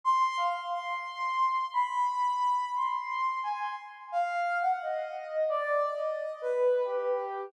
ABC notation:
X:1
M:5/4
L:1/16
Q:1/4=88
K:none
V:1 name="Ocarina"
c'2 f z | c'6 b6 c'4 ^g c' z2 | f3 ^f ^d4 (3=d4 ^d4 B4 G4 |]